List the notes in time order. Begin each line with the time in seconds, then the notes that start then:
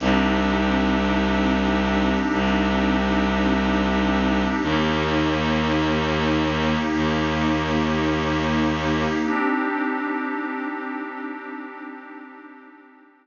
0.00 C2 C4 D4 D#4 G4
2.31 C2
4.61 D#2 A#3 D#4 G4
6.92 D#2
9.23 C4 D4 D#4 G4